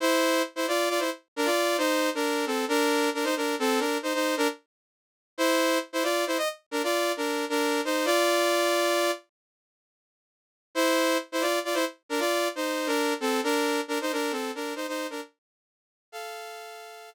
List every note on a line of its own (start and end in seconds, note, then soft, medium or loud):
0.00 0.42 E4 medium
0.00 0.42 C5 loud
0.56 0.66 E4 medium
0.56 0.66 C5 medium
0.68 0.89 F4 medium
0.68 0.89 D5 medium
0.89 1.00 F4 medium
0.89 1.00 D5 medium
0.99 1.10 E4 medium
0.99 1.10 C5 medium
1.36 1.47 D4 medium
1.36 1.47 A#4 medium
1.45 1.77 F4 medium
1.45 1.77 D5 medium
1.78 2.10 D#4 medium
1.78 2.10 C5 medium
2.15 2.45 D4 medium
2.15 2.45 A#4 medium
2.46 2.65 C4 medium
2.46 2.65 A4 medium
2.68 3.10 D4 medium
2.68 3.10 A#4 loud
3.14 3.25 D4 medium
3.14 3.25 A#4 medium
3.24 3.35 D#4 medium
3.24 3.35 C5 medium
3.37 3.55 D4 medium
3.37 3.55 A#4 medium
3.59 3.80 C4 medium
3.59 3.80 A4 medium
3.79 3.98 D4 medium
3.79 3.98 A#4 medium
4.03 4.13 D#4 medium
4.03 4.13 C5 medium
4.14 4.35 D#4 medium
4.14 4.35 C5 medium
4.37 4.48 D4 medium
4.37 4.48 A#4 loud
5.38 5.78 E4 medium
5.38 5.78 C5 loud
5.93 6.03 E4 medium
5.93 6.03 C5 medium
6.03 6.25 F4 medium
6.03 6.25 D5 medium
6.27 6.37 E4 medium
6.27 6.37 C5 medium
6.38 6.48 D#5 medium
6.71 6.82 D4 medium
6.71 6.82 A#4 medium
6.83 7.12 F4 medium
6.83 7.12 D5 medium
7.17 7.45 D4 medium
7.17 7.45 A#4 medium
7.49 7.81 D4 medium
7.49 7.81 A#4 medium
7.85 8.06 D#4 medium
7.85 8.06 C5 medium
8.05 9.11 F4 medium
8.05 9.11 D5 loud
10.75 11.17 E4 medium
10.75 11.17 C5 loud
11.32 11.43 E4 medium
11.32 11.43 C5 medium
11.41 11.59 F4 medium
11.41 11.59 D5 medium
11.65 11.75 F4 medium
11.65 11.75 D5 medium
11.74 11.85 E4 medium
11.74 11.85 C5 medium
12.09 12.20 D4 medium
12.09 12.20 A#4 medium
12.19 12.48 F4 medium
12.19 12.48 D5 medium
12.56 12.88 D#4 medium
12.56 12.88 C5 medium
12.87 13.14 D4 medium
12.87 13.14 A#4 medium
13.20 13.41 C4 medium
13.20 13.41 A4 medium
13.44 13.81 D4 medium
13.44 13.81 A#4 medium
13.88 13.99 D4 medium
13.88 13.99 A#4 medium
14.01 14.12 D#4 medium
14.01 14.12 C5 medium
14.12 14.32 D4 medium
14.12 14.32 A#4 medium
14.31 14.51 C4 medium
14.31 14.51 A4 medium
14.55 14.74 D4 medium
14.55 14.74 A#4 medium
14.76 14.86 D#4 medium
14.76 14.86 C5 medium
14.88 15.07 D#4 medium
14.88 15.07 C5 medium
15.10 15.21 D4 medium
15.10 15.21 A#4 medium
16.12 17.10 A4 medium
16.12 17.10 F5 medium